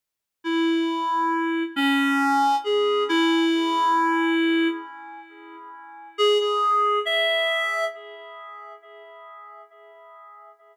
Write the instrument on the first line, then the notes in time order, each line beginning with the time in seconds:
clarinet
0.44 E4
1.76 C#4
2.64 G#4
3.09 E4
6.18 G#4
6.40 G#4
7.05 E5